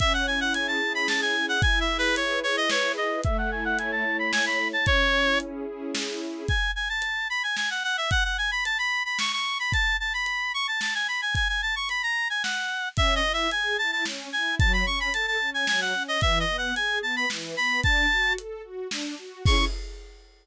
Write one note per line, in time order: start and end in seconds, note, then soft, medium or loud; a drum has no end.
0.00 0.81 C#4 medium
0.00 0.13 E5 loud
0.00 kick medium
0.00 closed hi-hat medium
0.14 0.26 F#5 medium
0.27 1.07 E4 medium
0.27 0.40 G#5 medium
0.41 0.53 F#5 medium
0.54 1.36 G#4 medium
0.54 0.67 G#5 medium
0.54 closed hi-hat loud
0.68 0.93 A5 medium
0.81 1.58 C#4 medium
0.95 1.08 B5 medium
1.08 1.59 E4 medium
1.08 1.21 A5 medium
1.08 snare medium
1.22 1.46 G#5 medium
1.36 1.62 G#4 medium
1.49 1.61 F#5 loud
1.61 2.42 E4 medium
1.61 1.79 G#5 loud
1.61 kick loud
1.61 closed hi-hat medium
1.80 1.97 E5 medium
1.88 2.71 G#4 medium
1.98 2.15 B4 loud
2.15 2.96 B4 medium
2.15 2.39 C#5 medium
2.15 closed hi-hat loud
2.43 3.20 E4 medium
2.43 2.56 C#5 medium
2.57 2.70 D#5 medium
2.69 3.23 G#4 medium
2.69 2.92 C#5 medium
2.69 snare loud
2.97 3.22 B4 medium
2.97 3.21 D#5 medium
3.24 4.04 A3 medium
3.24 3.37 E5 loud
3.24 kick medium
3.24 closed hi-hat medium
3.38 3.51 F#5 loud
3.51 4.34 E4 medium
3.51 3.64 G#5 medium
3.65 3.78 F#5 loud
3.78 4.59 C#5 medium
3.78 3.91 G#5 medium
3.78 closed hi-hat medium
3.92 4.17 A5 medium
4.05 4.82 A3 medium
4.19 4.32 B5 medium
4.32 4.85 E4 medium
4.32 4.45 G#5 loud
4.32 snare loud
4.46 4.68 B5 medium
4.59 4.85 C#5 medium
4.73 4.86 A5 loud
4.86 5.66 C#4 medium
4.86 5.39 C#5 loud
4.86 kick medium
4.86 closed hi-hat medium
5.13 5.94 E4 medium
5.40 6.20 G#4 medium
5.40 closed hi-hat medium
5.66 6.43 C#4 medium
5.95 6.46 E4 medium
5.95 snare loud
6.21 6.47 G#4 medium
6.48 6.71 G#5 medium
6.48 kick medium
6.48 closed hi-hat medium
6.76 6.89 G#5 medium
6.89 7.28 A5 medium
7.02 closed hi-hat medium
7.30 7.43 B5 medium
7.43 7.56 G#5 medium
7.57 7.70 G#5 medium
7.57 snare medium
7.70 7.83 F#5 medium
7.84 7.97 F#5 medium
7.97 8.10 E5 medium
8.11 8.24 F#5 loud
8.11 kick medium
8.11 closed hi-hat medium
8.24 8.37 F#5 medium
8.38 8.51 G#5 medium
8.51 8.64 B5 medium
8.65 8.78 A5 medium
8.65 closed hi-hat medium
8.78 9.03 B5 medium
9.05 9.18 B5 medium
9.19 9.32 C#6 medium
9.19 snare medium
9.32 9.58 C#6 medium
9.59 9.72 B5 medium
9.72 9.97 A5 loud
9.72 kick medium
9.72 closed hi-hat medium
10.00 10.13 A5 medium
10.14 10.52 B5 medium
10.26 closed hi-hat medium
10.54 10.67 C#6 medium
10.68 10.80 A5 medium
10.81 10.94 A5 medium
10.81 snare medium
10.94 11.07 G#5 medium
11.08 11.21 B5 medium
11.22 11.35 G#5 medium
11.35 11.48 G#5 loud
11.35 kick medium
11.35 closed hi-hat medium
11.49 11.61 G#5 medium
11.62 11.75 A5 medium
11.76 11.89 C#6 medium
11.89 12.02 B5 medium
11.89 closed hi-hat medium
12.03 12.28 A#5 medium
12.30 12.43 G#5 medium
12.43 12.89 F#5 medium
12.43 snare medium
12.97 13.21 C#4 medium
12.97 13.15 E5 loud
12.97 kick medium
12.97 closed hi-hat medium
13.15 13.32 D#5 loud
13.23 13.48 E4 medium
13.33 13.50 E5 medium
13.51 13.77 G#4 medium
13.51 13.77 G#5 medium
13.51 closed hi-hat medium
13.78 14.04 E4 medium
13.78 13.91 A5 medium
13.92 14.05 A5 medium
14.05 14.29 C#4 medium
14.05 snare medium
14.33 14.58 E4 medium
14.33 14.55 G#5 medium
14.59 14.84 F#3 medium
14.59 14.72 A5 loud
14.59 kick loud
14.59 closed hi-hat medium
14.73 14.86 B5 medium
14.85 15.09 C#4 medium
14.85 14.99 C#6 medium
15.00 15.13 B5 medium
15.13 15.37 A4 medium
15.13 15.26 A5 medium
15.13 closed hi-hat loud
15.27 15.50 A5 medium
15.40 15.65 C#4 medium
15.54 15.67 G#5 medium
15.67 15.93 F#3 medium
15.67 15.80 G#5 loud
15.67 snare medium
15.81 16.03 F#5 medium
15.93 16.18 C#4 medium
16.08 16.21 D#5 medium
16.21 16.45 E3 medium
16.21 16.39 E5 loud
16.21 kick medium
16.21 closed hi-hat medium
16.40 16.57 D#5 medium
16.49 16.73 B3 medium
16.58 16.75 F#5 medium
16.76 17.01 G#4 medium
16.76 16.99 G#5 medium
16.76 closed hi-hat medium
17.01 17.25 B3 medium
17.01 17.16 A5 medium
17.16 17.29 B5 medium
17.30 17.55 E3 medium
17.30 snare medium
17.57 17.81 B3 medium
17.57 17.81 B5 loud
17.83 18.07 D4 medium
17.83 18.33 A5 loud
17.83 kick medium
17.83 closed hi-hat medium
18.12 18.36 F#4 medium
18.38 18.62 A4 medium
18.38 closed hi-hat medium
18.63 18.88 F#4 medium
18.91 19.15 D4 medium
18.91 snare medium
19.18 19.43 F#4 medium
19.45 19.65 C#4 loud
19.45 19.65 E4 loud
19.45 19.65 G#4 loud
19.45 19.65 C#6 loud
19.45 kick loud
19.45 crash loud